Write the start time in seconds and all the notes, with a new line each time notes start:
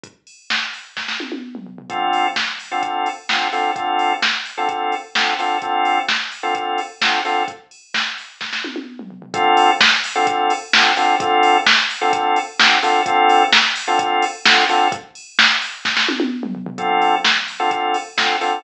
0.03 kick, closed hi-hat
0.27 open hi-hat
0.50 kick, snare
0.73 open hi-hat
0.97 kick, snare
1.08 snare
1.20 high tom
1.32 high tom
1.55 mid tom
1.66 floor tom
1.78 floor tom
1.90 D3 C4 F4 A4, kick, closed hi-hat
2.13 open hi-hat
2.36 kick, snare
2.59 open hi-hat
2.71 D3 C4 F4 A4
2.83 kick, closed hi-hat
3.06 open hi-hat
3.29 D3 C4 F4 A4, kick, snare
3.52 D3 C4 F4 A4, open hi-hat
3.76 D3 C4 F4 A4, kick, closed hi-hat
3.99 open hi-hat
4.22 kick, snare
4.45 open hi-hat
4.57 D3 C4 F4 A4
4.69 kick, closed hi-hat
4.92 open hi-hat
5.15 D3 C4 F4 A4, kick, snare
5.39 D3 C4 F4 A4, open hi-hat
5.62 D3 C4 F4 A4, kick, closed hi-hat
5.85 open hi-hat
6.08 kick, snare
6.31 open hi-hat
6.43 D3 C4 F4 A4
6.55 kick, closed hi-hat
6.78 open hi-hat
7.01 D3 C4 F4 A4, kick, snare
7.25 D3 C4 F4 A4, open hi-hat
7.48 kick, closed hi-hat
7.71 open hi-hat
7.94 kick, snare
8.18 open hi-hat
8.41 kick, snare
8.53 snare
8.64 high tom
8.76 high tom
8.99 mid tom
9.10 floor tom
9.22 floor tom
9.34 D3 C4 F4 A4, kick, closed hi-hat
9.57 open hi-hat
9.80 kick, snare
10.04 open hi-hat
10.15 D3 C4 F4 A4
10.27 kick, closed hi-hat
10.50 open hi-hat
10.73 D3 C4 F4 A4, kick, snare
10.97 D3 C4 F4 A4, open hi-hat
11.20 D3 C4 F4 A4, kick, closed hi-hat
11.43 open hi-hat
11.66 kick, snare
11.90 open hi-hat
12.01 D3 C4 F4 A4
12.13 kick, closed hi-hat
12.36 open hi-hat
12.59 D3 C4 F4 A4, kick, snare
12.83 D3 C4 F4 A4, open hi-hat
13.06 D3 C4 F4 A4, kick, closed hi-hat
13.29 open hi-hat
13.52 kick, snare
13.76 open hi-hat
13.87 D3 C4 F4 A4
13.99 kick, closed hi-hat
14.22 open hi-hat
14.45 D3 C4 F4 A4, kick, snare
14.69 D3 C4 F4 A4, open hi-hat
14.92 kick, closed hi-hat
15.15 open hi-hat
15.39 kick, snare
15.62 open hi-hat
15.85 kick, snare
15.97 snare
16.08 high tom
16.20 high tom
16.43 mid tom
16.55 floor tom
16.66 floor tom
16.78 D3 C4 F4 A4, kick, closed hi-hat
17.02 open hi-hat
17.25 kick, snare
17.48 open hi-hat
17.59 D3 C4 F4 A4
17.71 kick, closed hi-hat
17.94 open hi-hat
18.17 D3 C4 F4 A4, kick, snare
18.41 D3 C4 F4 A4, open hi-hat